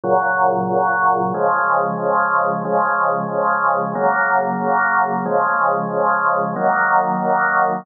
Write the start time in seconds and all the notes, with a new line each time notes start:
0.04 A#2 C#3 F#3
1.34 C#3 F3 G#3
2.65 C#3 F3 G#3
3.95 C#3 F#3 A#3
5.26 C#3 F3 G#3
6.56 D#3 F#3 A#3